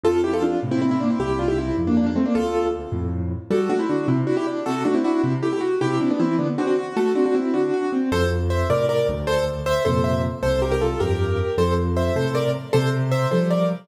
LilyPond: <<
  \new Staff \with { instrumentName = "Acoustic Grand Piano" } { \time 6/8 \key f \major \tempo 4. = 104 <f' a'>8 <e' g'>16 <f' a'>16 <d' f'>8 r16 <c' e'>16 <c' e'>16 <c' e'>16 <bes d'>16 <c' e'>16 | <e' g'>8 <d' f'>16 <e' g'>16 <c' e'>8 r16 <bes d'>16 <bes d'>16 <bes d'>16 <a c'>16 <bes d'>16 | <f' a'>4 r2 | \key g \major <fis' a'>8 <d' fis'>16 <c' e'>16 <d' fis'>8 <c' e'>16 r16 <d' fis'>16 <e' g'>16 r8 |
<fis' a'>8 <d' fis'>16 <c' e'>16 <d' fis'>8 <c' e'>16 r16 <e' g'>16 <e' g'>16 r8 | <e' g'>8 <c' e'>16 <b d'>16 <c' e'>8 <b d'>16 r16 <d' fis'>16 <d' fis'>16 r8 | <fis' a'>8 <d' fis'>16 <d' fis'>16 <c' e'>8 <d' fis'>4 r8 | \key f \major <a' c''>8 r8 <c'' e''>8 <bes' d''>8 <bes' d''>8 r8 |
<a' c''>8 r8 <c'' e''>8 <a' c''>8 <c'' e''>8 r8 | <a' c''>8 <g' bes'>16 <g' bes'>16 <f' a'>8 <g' bes'>4. | <a' c''>8 r8 <c'' e''>8 <a' c''>8 <bes' d''>8 r8 | <a' c''>8 r8 <c'' e''>8 <a' c''>8 <bes' d''>8 r8 | }
  \new Staff \with { instrumentName = "Acoustic Grand Piano" } { \time 6/8 \key f \major f,4. <a, c>4. | c,4. <f, g,>4. | d,4. <f, a,>4. | \key g \major g8 a8 d8 c8 e'8 d'8 |
c8 a8 e'8 c8 a8 fis'8 | c8 d'8 e8 d8 c'8 fis'8 | a8 c'8 r8 d8 fis'8 c'8 | \key f \major f,4. <a, c>4 d,8~ |
d,4. <f, bes, c>4. | c,4. <f, g,>4. | f,4. <a, c>4. | c4. <f g>4. | }
>>